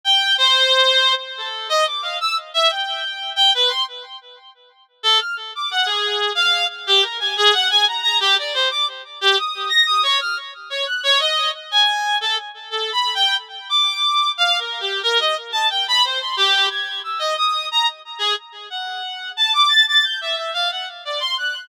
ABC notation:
X:1
M:5/8
L:1/16
Q:1/4=90
K:none
V:1 name="Clarinet"
g2 c5 z A2 | _e d' f =e' z =e g4 | g B c' z7 | A f' z d' _g _A3 f2 |
z G _B _a _A _g a _b b =G | d c d' z2 G _e'2 _b' e' | _d f' z2 d _g' d _e2 z | _a3 =A z2 (3A2 b2 g2 |
z2 d'4 (3f2 _B2 G2 | _B _e z a g =b c c' G2 | _a'2 e' _e _e'2 _b z2 _A | z2 _g4 a d' a' a' |
g' e e f _g z d c' _g'2 |]